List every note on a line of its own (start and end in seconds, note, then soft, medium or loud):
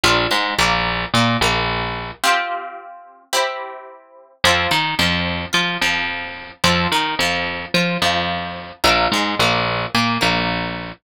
0.04 0.27 A#1 medium
0.04 0.29 D4 medium
0.04 0.29 F4 loud
0.04 0.29 A#4 medium
0.31 0.54 G#2 medium
0.31 0.54 G#3 medium
0.58 1.05 A#1 medium
0.58 1.05 A#3 medium
1.14 1.37 A#2 medium
1.14 1.38 A#3 medium
1.41 2.11 A#1 medium
1.41 2.13 A#3 medium
2.24 3.23 C4 medium
2.24 3.23 F4 medium
2.24 3.23 G4 medium
3.33 4.32 C4 medium
3.33 4.32 E4 medium
3.33 4.32 G4 medium
4.44 4.67 F2 medium
4.44 4.70 C4 medium
4.44 4.70 F4 medium
4.44 4.70 A4 medium
4.71 4.95 D#3 medium
4.71 4.94 D#4 medium
4.99 5.46 F2 medium
4.99 5.46 F3 medium
5.53 5.77 F3 medium
5.53 5.76 F4 medium
5.81 6.52 F2 medium
5.81 6.52 F3 medium
6.64 6.87 F2 medium
6.64 6.89 C4 medium
6.64 6.89 F4 medium
6.64 6.89 A4 medium
6.92 7.15 D#3 medium
6.92 7.16 D#4 medium
7.19 7.66 F2 medium
7.19 7.67 F3 medium
7.74 7.98 F3 medium
7.74 7.98 F4 medium
8.02 8.72 F2 medium
8.02 8.72 F3 medium
8.84 9.08 A#1 medium
8.84 9.09 D4 medium
8.84 9.09 F4 medium
8.84 9.09 A#4 medium
9.12 9.35 G#2 medium
9.12 9.37 G#3 medium
9.39 9.86 A#1 medium
9.39 9.87 A#3 medium
9.95 10.18 A#2 medium
9.95 10.18 A#3 medium
10.21 10.92 A#1 medium
10.21 10.91 A#3 medium